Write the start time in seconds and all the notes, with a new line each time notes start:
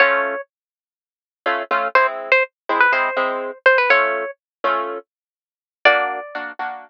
0.00 A3 C#4 F4 C#5
1.46 A3 C#4 F4
1.71 A3 C#4 F4
1.95 G#3 C4 E4 C5
2.32 C5
2.69 G#3 C4 E4
2.80 B4
2.92 G#3 C4 E4 C5
3.16 G#3 C4 E4
3.66 C5
3.78 B4
3.90 A3 C#4 F4 C#5
4.64 A3 C#4 F4
5.85 A#3 D4 F#4 D5
6.35 A#3 D4 F#4
6.59 A#3 D4 F#4